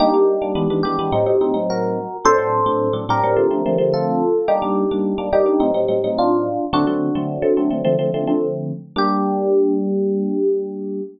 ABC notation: X:1
M:4/4
L:1/16
Q:1/4=107
K:Gm
V:1 name="Electric Piano 1"
[EG]6 G6 [_GB]4 | [Ac]6 [GB]6 [FA]4 | [EG]6 [EG]6 [DF]4 | [D^F]10 z6 |
G16 |]
V:2 name="Electric Piano 1"
[G,B,D] [G,B,D]2 [G,B,D] [=E,^G,=B,D] [E,G,B,D] [E,G,B,D] [E,G,B,D] [A,,_G,C_E] [A,,G,CE] [A,,G,CE] [A,,G,CE]5 | [A,,^F,CD] [A,,F,CD]2 [A,,F,CD]2 [A,,F,CD] [A,,F,CD] [A,,F,CD] [D,=F,A,C] [D,F,A,C] [D,F,A,C] [D,F,A,C]5 | [G,B,D] [G,B,D]2 [G,B,D]2 [G,B,D] [G,B,D] [G,B,D] [A,,_G,CE] [A,,G,CE] [A,,G,CE] [A,,G,CE]5 | [D,^F,A,C] [D,F,A,C]2 [D,F,A,C]2 [D,F,A,C] [D,F,A,C] [D,F,A,C] [D,=F,A,C] [D,F,A,C] [D,F,A,C] [D,F,A,C]5 |
[G,B,D]16 |]